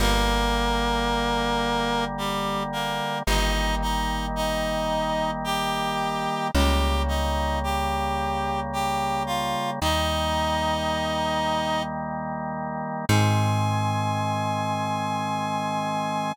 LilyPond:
<<
  \new Staff \with { instrumentName = "Clarinet" } { \time 3/4 \key aes \major \tempo 4 = 55 <bes bes'>2 <g g'>8 <bes bes'>8 | <ees' ees''>8 <ees' ees''>8 <ees' ees''>4 <g' g''>4 | <g' g''>8 <ees' ees''>8 <g' g''>4 <g' g''>8 <f' f''>8 | <ees' ees''>2 r4 |
aes''2. | }
  \new Staff \with { instrumentName = "Drawbar Organ" } { \time 3/4 \key aes \major <d g bes>2. | <ees g bes>2. | <des g bes>2. | <ees g bes>2. |
<ees aes c'>2. | }
  \new Staff \with { instrumentName = "Electric Bass (finger)" } { \clef bass \time 3/4 \key aes \major g,,2. | g,,2. | des,2. | ees,2. |
aes,2. | }
>>